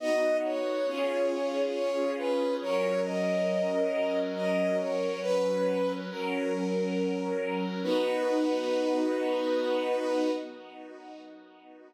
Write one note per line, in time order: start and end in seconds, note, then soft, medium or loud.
0.00 0.86 B3 medium
0.00 0.78 B3 medium
0.00 0.86 D#4 medium
0.00 0.78 D#4 medium
0.00 0.86 F#4 medium
0.00 0.78 F#4 medium
0.00 0.37 D#5 loud
0.44 1.61 C#5 medium
0.87 2.43 C#4 medium
0.87 2.59 C#4 medium
0.87 2.43 F4 loud
0.87 2.59 F4 medium
0.87 2.43 G#4 medium
0.87 2.59 G#4 medium
1.74 2.13 C#5 medium
2.18 2.55 B4 medium
2.61 5.19 F#3 medium
2.61 4.96 F#3 medium
2.61 5.19 C#4 medium
2.61 4.96 C#4 medium
2.61 5.19 A#4 medium
2.61 4.96 A#4 medium
2.61 3.00 C#5 loud
3.04 4.20 D#5 medium
4.35 4.77 D#5 loud
4.79 5.20 C#5 medium
5.22 6.00 F#3 medium
5.22 6.08 F#3 medium
5.22 6.00 C#4 medium
5.22 6.08 C#4 medium
5.22 5.92 B4 loud
5.22 6.00 B4 medium
5.22 6.08 B4 medium
6.09 7.65 F#3 medium
6.09 7.81 F#3 medium
6.09 7.65 C#4 medium
6.09 7.81 C#4 medium
6.09 7.65 A#4 medium
6.09 7.81 A#4 medium
7.83 10.30 B3 loud
7.83 10.30 D#4 loud
7.83 10.30 F#4 loud
7.83 10.31 B4 loud